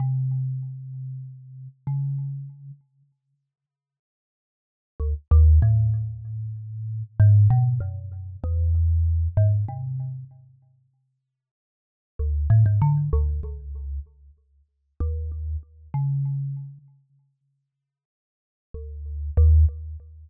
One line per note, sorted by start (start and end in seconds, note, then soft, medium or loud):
0.00 1.68 C3 medium
1.87 2.71 C#3 medium
5.00 5.14 D2 medium
5.31 5.59 D#2 loud
5.62 7.03 A2 medium
7.20 7.48 G#2 loud
7.50 7.79 B2 loud
7.80 8.37 F#2 medium
8.44 9.28 E2 medium
9.37 9.65 G#2 loud
9.68 10.25 C3 medium
12.19 12.47 D2 medium
12.50 12.64 A2 loud
12.66 12.80 G#2 medium
12.82 13.10 D3 medium
13.13 13.41 D2 loud
13.43 14.00 C#2 medium
15.00 15.57 D#2 loud
15.94 16.78 C#3 medium
18.74 19.31 D2 medium
19.37 19.65 D#2 loud